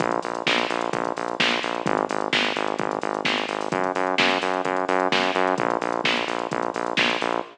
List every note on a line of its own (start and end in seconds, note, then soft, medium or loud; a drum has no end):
0.00 0.20 A#1 loud
0.00 kick loud
0.00 closed hi-hat loud
0.11 closed hi-hat medium
0.22 0.43 A#1 medium
0.22 open hi-hat loud
0.35 closed hi-hat loud
0.47 0.66 A#1 medium
0.47 kick loud
0.47 snare loud
0.58 closed hi-hat medium
0.70 0.90 A#1 medium
0.70 open hi-hat loud
0.81 closed hi-hat loud
0.93 1.13 A#1 medium
0.93 kick loud
0.93 closed hi-hat loud
1.05 closed hi-hat medium
1.16 1.36 A#1 medium
1.16 open hi-hat medium
1.28 closed hi-hat medium
1.40 1.59 A#1 medium
1.40 kick loud
1.40 snare loud
1.51 closed hi-hat medium
1.63 1.83 A#1 medium
1.63 open hi-hat loud
1.75 closed hi-hat medium
1.86 2.06 G#1 loud
1.86 kick loud
1.86 closed hi-hat loud
1.97 closed hi-hat medium
2.09 2.29 G#1 medium
2.09 open hi-hat loud
2.21 closed hi-hat medium
2.33 2.52 G#1 medium
2.33 kick loud
2.33 snare loud
2.44 closed hi-hat medium
2.56 2.76 G#1 medium
2.56 open hi-hat medium
2.68 closed hi-hat medium
2.79 2.99 G#1 medium
2.79 kick loud
2.79 closed hi-hat loud
2.91 closed hi-hat medium
3.02 3.22 G#1 medium
3.02 open hi-hat medium
3.14 closed hi-hat medium
3.25 3.45 G#1 medium
3.25 kick loud
3.25 snare loud
3.38 closed hi-hat medium
3.48 3.69 G#1 medium
3.48 open hi-hat loud
3.61 open hi-hat medium
3.72 3.92 F#2 medium
3.72 kick loud
3.72 closed hi-hat loud
3.84 closed hi-hat medium
3.95 4.15 F#2 medium
3.95 open hi-hat medium
4.07 closed hi-hat medium
4.18 4.38 F#2 medium
4.18 kick loud
4.18 snare loud
4.31 closed hi-hat medium
4.42 4.62 F#2 medium
4.42 open hi-hat loud
4.54 closed hi-hat medium
4.65 4.85 F#2 medium
4.65 kick medium
4.65 closed hi-hat loud
4.76 closed hi-hat medium
4.88 5.08 F#2 loud
4.88 open hi-hat loud
5.00 closed hi-hat medium
5.12 5.31 F#2 medium
5.12 kick loud
5.12 snare loud
5.23 closed hi-hat medium
5.35 5.55 F#2 loud
5.35 open hi-hat medium
5.47 closed hi-hat medium
5.58 5.78 A#1 loud
5.58 kick loud
5.58 closed hi-hat loud
5.70 closed hi-hat medium
5.81 6.01 A#1 medium
5.81 open hi-hat medium
5.92 closed hi-hat medium
6.04 6.24 A#1 medium
6.04 kick loud
6.04 snare loud
6.17 closed hi-hat medium
6.28 6.48 A#1 medium
6.28 open hi-hat loud
6.39 closed hi-hat medium
6.51 6.71 A#1 medium
6.51 kick loud
6.51 closed hi-hat loud
6.63 closed hi-hat medium
6.74 6.94 A#1 medium
6.74 open hi-hat medium
6.86 closed hi-hat medium
6.97 7.17 A#1 medium
6.97 kick loud
6.97 snare loud
7.10 closed hi-hat medium
7.21 7.41 A#1 medium
7.21 open hi-hat loud
7.32 closed hi-hat medium